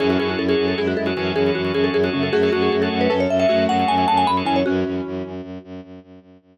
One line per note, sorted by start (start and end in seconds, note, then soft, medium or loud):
0.00 0.17 F#2 loud
0.00 0.73 E3 medium
0.00 0.73 C#4 medium
0.00 0.08 F#4 medium
0.00 0.09 G#4 medium
0.00 0.08 G#4 medium
0.00 0.08 A4 medium
0.00 0.08 C#5 medium
0.10 0.19 F#4 medium
0.10 0.18 F#4 medium
0.10 0.18 G#4 medium
0.10 0.18 A4 medium
0.10 0.18 C#5 medium
0.19 0.36 F#2 medium
0.19 0.43 F#4 medium
0.19 0.29 G#4 medium
0.19 0.43 G#4 medium
0.19 0.43 A4 medium
0.19 0.43 C#5 medium
0.29 0.39 F#4 medium
0.38 0.55 F#2 medium
0.38 0.48 A4 medium
0.48 0.80 F#4 medium
0.48 0.66 G#4 medium
0.48 0.80 G#4 medium
0.48 0.80 A4 medium
0.48 0.80 C#5 medium
0.58 0.74 F#2 medium
0.68 0.77 A4 medium
0.78 0.95 F#2 medium
0.78 1.10 G#3 medium
0.78 1.10 E4 medium
0.78 0.87 G#4 medium
0.87 0.97 F#4 medium
0.97 1.13 F#2 medium
0.97 1.06 A4 medium
1.06 1.14 F#4 medium
1.06 1.31 F#4 medium
1.06 1.14 G#4 medium
1.06 1.14 A4 medium
1.06 1.14 C#5 medium
1.16 1.33 F#2 medium
1.16 2.09 E3 medium
1.16 2.09 C#4 medium
1.16 1.32 F#4 medium
1.16 1.32 G#4 medium
1.16 1.32 A4 medium
1.16 1.32 C#5 medium
1.34 1.50 F#2 medium
1.34 1.44 F#4 medium
1.34 1.51 G#4 medium
1.34 1.44 G#4 medium
1.34 1.44 A4 medium
1.34 1.44 C#5 medium
1.46 1.62 F#4 medium
1.46 1.62 G#4 medium
1.46 1.62 A4 medium
1.46 1.62 C#5 medium
1.55 1.72 F#2 medium
1.55 1.73 F#4 medium
1.64 1.72 F#4 medium
1.64 1.72 G#4 medium
1.64 1.72 A4 medium
1.64 1.72 C#5 medium
1.73 1.89 F#2 medium
1.73 1.97 F#4 medium
1.73 1.97 G#4 medium
1.73 1.84 G#4 medium
1.73 1.97 A4 medium
1.73 1.97 C#5 medium
1.84 1.93 A4 medium
1.93 2.09 F#2 medium
1.93 2.03 G#4 medium
2.03 2.35 F#4 medium
2.03 2.13 F#4 medium
2.03 2.35 G#4 medium
2.03 2.35 A4 medium
2.03 2.35 C#5 medium
2.13 2.29 F#2 medium
2.13 2.31 C#3 medium
2.13 2.31 A3 medium
2.13 2.23 C#4 medium
2.23 2.32 A4 medium
2.33 2.50 F#2 medium
2.33 3.08 A3 medium
2.33 3.08 F#4 medium
2.33 2.42 G#4 medium
2.43 2.51 F#4 medium
2.43 2.51 G#4 medium
2.43 2.52 G#4 medium
2.43 2.51 A4 medium
2.43 2.51 C#5 medium
2.53 2.69 F#2 medium
2.53 2.62 F#4 medium
2.53 2.76 F#4 medium
2.53 2.76 G#4 medium
2.53 2.76 A4 medium
2.53 2.76 C#5 medium
2.62 2.71 G#4 medium
2.72 2.89 F#2 medium
2.72 2.82 G#4 medium
2.82 3.13 F#4 medium
2.82 3.13 G#4 medium
2.82 2.98 A4 medium
2.82 3.13 A4 medium
2.82 3.13 C#5 medium
2.91 3.08 F#2 medium
3.01 3.10 B4 medium
3.10 3.27 F#2 medium
3.10 3.47 C#4 medium
3.10 3.47 A4 medium
3.10 3.20 B4 medium
3.20 3.30 C#5 medium
3.29 3.45 F#2 medium
3.29 3.39 E5 medium
3.39 3.47 F#4 medium
3.39 3.47 G#4 medium
3.39 3.47 A4 medium
3.39 3.47 C#5 medium
3.39 3.65 E5 medium
3.49 3.67 F#2 medium
3.49 4.28 A3 medium
3.49 3.64 F#4 medium
3.49 4.28 F#4 medium
3.49 3.64 G#4 medium
3.49 3.64 A4 medium
3.49 3.64 C#5 medium
3.68 3.84 F#2 medium
3.68 3.77 F#4 medium
3.68 3.77 G#4 medium
3.68 3.77 A4 medium
3.68 3.77 C#5 medium
3.68 3.88 F#5 medium
3.79 3.95 F#4 medium
3.79 3.95 G#4 medium
3.79 3.95 A4 medium
3.79 3.95 C#5 medium
3.88 4.05 F#2 medium
3.88 4.07 G#5 medium
3.98 4.05 F#4 medium
3.98 4.05 G#4 medium
3.98 4.05 A4 medium
3.98 4.05 C#5 medium
4.08 4.25 F#2 medium
4.08 4.31 F#4 medium
4.08 4.31 G#4 medium
4.08 4.31 A4 medium
4.08 4.31 C#5 medium
4.08 4.17 A5 medium
4.17 4.27 G#5 medium
4.26 4.42 F#2 medium
4.26 4.36 B5 medium
4.37 4.60 F#4 medium
4.37 4.60 G#4 medium
4.37 4.60 A4 medium
4.37 4.60 C#5 medium
4.45 4.63 F#2 medium
4.45 4.62 E3 medium
4.45 4.62 C#4 medium
4.45 4.56 G#5 medium
4.56 4.65 C#5 medium
4.66 4.84 F#2 loud
4.66 5.32 E3 medium
4.66 5.32 C#4 medium
4.66 5.80 F#4 medium
4.84 5.01 F#2 medium
5.06 5.23 F#2 medium
5.25 5.41 F#2 medium
5.42 5.58 F#2 medium
5.64 5.81 F#2 medium
5.83 5.99 F#2 medium
6.03 6.19 F#2 medium
6.21 6.37 F#2 medium
6.41 6.58 F#2 medium